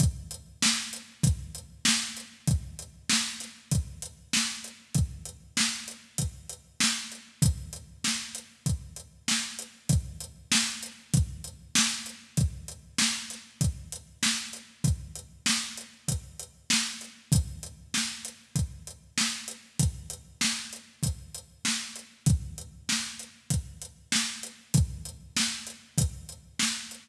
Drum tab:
HH |xx-xxx-x|xx-xxx-x|xx-xxx-x|xx-xxx-x|
SD |--o---o-|--oo--o-|--o---o-|--o---o-|
BD |o---o---|o---o---|o---o---|o---o---|

HH |xx-xxx-x|xx-xxx-x|xx-xxx-x|xx-xxx-x|
SD |--o---o-|--oo--o-|--o---o-|--o---o-|
BD |o---o---|o---o---|o---o---|o---o---|

HH |xx-xxx-x|xx-xxx-x|xx-xxx-x|
SD |--o---o-|--o---o-|--o---o-|
BD |o---o---|o---o---|o---o---|